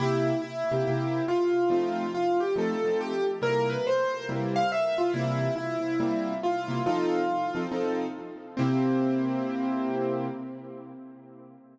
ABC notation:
X:1
M:4/4
L:1/8
Q:"Swing" 1/4=140
K:C
V:1 name="Acoustic Grand Piano"
E2 E4 F2 | F2 F G A2 G z | _B =B c2 z f e F | E2 E4 F2 |
F4 z4 | C8 |]
V:2 name="Acoustic Grand Piano"
[C,_B,G]3 [C,B,EG] [C,B,EG]4 | [F,A,C_E]4 [F,A,CE] [F,A,CE]3 | [C,G,_B,E]4 [C,G,B,E]4 | [C,E,G,_B,]4 [C,G,B,E]3 [C,G,B,E] |
[F,C_EA]3 [F,CEA] [F,CEA]4 | [C,_B,EG]8 |]